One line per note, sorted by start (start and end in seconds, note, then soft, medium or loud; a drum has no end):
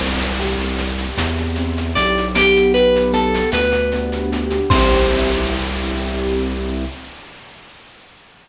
0.00 1.06 C2 loud
0.00 0.77 C4 medium
0.00 crash medium
0.19 shaker medium
0.39 1.96 G4 medium
0.39 shaker medium
0.59 shaker medium
0.77 1.58 C4 medium
0.77 shaker medium
0.98 shaker medium
1.17 1.92 E2 medium
1.17 2.30 E4 medium
1.17 shaker loud
1.38 shaker medium
1.55 2.33 C4 medium
1.55 shaker medium
1.77 shaker medium
1.95 3.42 B1 loud
1.95 2.33 G4 medium
1.95 2.28 D5 loud
1.95 shaker medium
2.17 shaker medium
2.35 3.13 B3 medium
2.35 2.73 G4 loud
2.35 shaker loud
2.56 shaker medium
2.74 4.32 G4 medium
2.74 3.12 B4 loud
2.74 shaker medium
2.96 shaker medium
3.13 3.92 B3 medium
3.13 3.50 A4 loud
3.13 shaker medium
3.34 shaker medium
3.52 4.59 D2 loud
3.52 4.66 D4 medium
3.52 4.26 B4 loud
3.52 shaker loud
3.72 shaker medium
3.92 4.67 B3 medium
3.92 shaker medium
4.12 shaker medium
4.32 4.69 G4 medium
4.32 shaker medium
4.50 shaker medium
4.70 6.84 C2 loud
4.70 6.84 C4 medium
4.70 6.84 E4 loud
4.70 6.84 C5 loud
4.70 kick loud
4.70 crash loud
4.75 6.84 G4 medium